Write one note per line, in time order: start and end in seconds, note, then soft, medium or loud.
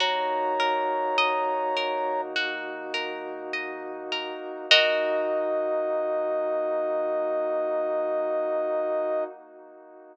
0.00 4.33 D#2 loud
0.00 4.65 A#3 medium
0.00 4.65 D#4 medium
0.00 4.65 F#4 medium
0.00 2.35 F#4 medium
0.00 2.21 C#5 medium
0.00 2.21 A#5 medium
0.60 1.76 A#4 medium
1.18 3.53 D#5 medium
1.77 2.93 A#4 medium
2.36 4.59 F#4 medium
2.94 4.12 A#4 medium
3.53 4.65 D#5 medium
4.12 4.68 A#4 medium
4.70 9.24 D#2 loud
4.70 9.24 A#3 loud
4.70 9.24 D#4 loud
4.70 9.24 F#4 loud
4.70 9.25 F#4 loud
4.70 9.25 A#4 medium
4.70 9.24 D#5 loud
4.70 9.25 D#5 loud